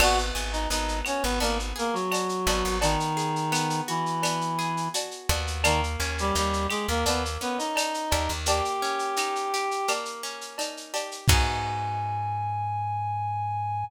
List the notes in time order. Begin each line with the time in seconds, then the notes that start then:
0.00 G#1 B3 F#4 F#5, crash, cowbell, claves
0.18 shaker
0.35 G#1 G#4, shaker
0.52 D#4 D#5, shaker
0.70 G#1 B3 D#4 D#5, shaker
0.88 shaker
1.05 C#4 F#4 C#5, claves, shaker
1.22 G#1 B3 B4, shaker
1.40 G#1 A#3 B3 A#4, cowbell, shaker
1.60 shaker
1.76 A#3 G#4 A#4, shaker
1.93 F#3 F#4, shaker
2.11 F#4, cowbell, claves, shaker
2.29 shaker
2.47 G#1 B3, cowbell, shaker
2.65 G#1, shaker
2.81 D#3 B3 D#4, cowbell, shaker
3.00 shaker
3.17 G#4, shaker
3.36 shaker
3.52 B3, claves, shaker
3.70 shaker
3.88 E3 E4 F#4, shaker
4.06 shaker
4.22 B3, cowbell, claves, shaker
4.41 shaker
4.59 G#4, shaker
4.77 shaker
4.94 F#4, cowbell, shaker
5.11 shaker
5.29 D#2 B3, cowbell, shaker
5.47 shaker
5.64 D#3 A#3 D#4, cowbell, claves, shaker
5.84 shaker
6.00 D#2 C#4, shaker
6.18 G3 G4, shaker
6.35 D#2 G3 D#4 G4, shaker
6.53 shaker
6.70 G#3 G4 G#4, claves, shaker
6.89 D#2 A#3 A#4, shaker
7.06 D#2 A#3 B3 B4, cowbell, shaker
7.25 shaker
7.41 B3 C#4 B4, shaker
7.58 D#4 D#5, shaker
7.76 D#4, cowbell, claves, shaker
7.94 shaker
8.11 D#2 G4, cowbell, shaker
8.29 D#2, shaker
8.46 A#3 G4 G5, cowbell, shaker
8.65 shaker
8.82 C#4, shaker
8.99 shaker
9.16 D#4, claves, shaker
9.36 shaker
9.54 G4, shaker
9.71 shaker
9.88 A#3, cowbell, claves, shaker
10.05 shaker
10.23 C#4, shaker
10.41 shaker
10.58 D#4, cowbell, shaker
10.77 shaker
10.94 G4, cowbell, shaker
11.11 shaker
11.28 G#2 B3 D#4 F#4 G#4 G#5, kick, crash